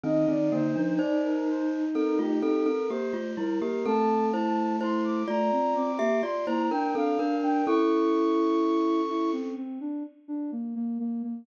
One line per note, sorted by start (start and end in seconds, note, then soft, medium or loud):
0.04 0.26 D#3 medium
0.04 0.26 C4 loud
0.04 2.68 D#4 loud
0.04 0.26 D#5 loud
0.28 0.51 D#3 medium
0.28 0.51 C4 medium
0.28 0.50 D5 loud
0.51 0.75 D3 medium
0.51 0.75 A#3 medium
0.51 0.93 C5 loud
0.76 0.98 F3 medium
0.76 0.98 D4 medium
0.98 1.85 D#4 medium
0.98 1.85 C5 medium
0.98 1.21 D5 loud
1.23 1.46 A#4 loud
1.48 1.70 C5 loud
1.94 2.18 C4 medium
1.94 2.18 A4 medium
1.94 2.17 A#4 loud
2.19 2.41 A3 medium
2.19 2.41 F4 medium
2.19 2.63 G4 loud
2.42 2.65 C4 medium
2.42 2.65 A4 medium
2.65 2.88 C4 medium
2.65 2.88 A4 medium
2.65 2.88 A#4 loud
2.89 3.13 A#3 medium
2.89 3.13 G4 medium
2.89 3.31 C5 loud
3.13 3.36 A3 medium
3.13 3.36 F4 medium
3.37 3.60 G3 medium
3.37 3.60 E4 medium
3.37 3.60 A#4 loud
3.60 3.84 A#3 medium
3.60 3.84 G4 medium
3.60 3.83 A#4 loud
3.85 5.24 A3 loud
3.85 4.31 C4 medium
3.85 4.31 A4 loud
3.85 4.26 A5 loud
4.32 4.76 E4 medium
4.32 4.76 C5 medium
4.32 4.75 A5 loud
4.81 5.23 E4 medium
4.81 5.23 C5 medium
4.81 5.04 C6 loud
5.04 5.27 D6 loud
5.28 5.51 A3 loud
5.28 5.92 F4 medium
5.28 5.92 D5 medium
5.28 5.74 A#5 loud
5.52 5.74 C4 medium
5.75 5.98 C4 loud
5.75 6.16 D6 loud
5.99 6.22 A#3 medium
5.99 6.21 G4 medium
5.99 6.21 E5 loud
6.23 6.46 F4 medium
6.23 6.46 D5 medium
6.23 6.45 C6 loud
6.46 6.70 A#3 medium
6.46 6.70 E4 medium
6.46 6.70 C5 medium
6.46 6.68 A#5 loud
6.70 6.93 D4 medium
6.70 6.94 D4 medium
6.70 6.94 A#4 medium
6.70 6.93 G5 loud
6.95 7.18 C4 medium
6.95 7.17 D4 loud
6.95 7.18 A4 medium
6.95 7.36 F5 loud
7.19 7.41 D4 medium
7.19 7.62 D4 medium
7.19 7.62 A#4 medium
7.42 7.65 D4 loud
7.42 7.65 G5 loud
7.66 9.52 C#4 medium
7.66 9.01 E4 loud
7.66 9.52 A4 loud
7.66 9.30 C#6 loud
9.09 9.32 E4 medium
9.33 9.55 C4 medium
9.56 9.79 C4 medium
9.81 10.03 D4 medium
10.28 10.51 D4 medium
10.52 10.74 A#3 medium
10.75 10.98 A#3 loud
11.00 11.22 A#3 loud
11.23 11.46 A#3 medium